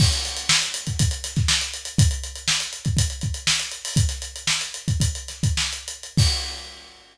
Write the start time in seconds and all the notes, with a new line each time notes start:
0.00 kick, crash
0.12 closed hi-hat
0.25 snare, closed hi-hat
0.37 closed hi-hat
0.49 snare
0.62 closed hi-hat
0.74 closed hi-hat
0.87 kick, closed hi-hat
0.99 kick, closed hi-hat
1.11 closed hi-hat
1.24 snare, closed hi-hat
1.36 kick, snare, closed hi-hat
1.48 snare
1.61 snare, closed hi-hat
1.74 closed hi-hat
1.85 closed hi-hat
1.98 kick, closed hi-hat
2.11 closed hi-hat
2.23 closed hi-hat
2.35 closed hi-hat
2.48 snare
2.60 closed hi-hat
2.73 closed hi-hat
2.85 kick, closed hi-hat
2.97 kick, closed hi-hat
3.10 closed hi-hat
3.21 kick, closed hi-hat
3.34 closed hi-hat
3.47 snare
3.60 closed hi-hat
3.71 closed hi-hat
3.85 open hi-hat
3.96 kick, closed hi-hat
4.09 snare, closed hi-hat
4.22 closed hi-hat
4.36 closed hi-hat
4.47 snare
4.61 closed hi-hat
4.74 closed hi-hat
4.88 kick, closed hi-hat
5.00 kick, closed hi-hat
5.15 closed hi-hat
5.28 snare, closed hi-hat
5.43 kick, closed hi-hat
5.57 snare
5.73 closed hi-hat
5.88 closed hi-hat
6.03 closed hi-hat
6.17 kick, crash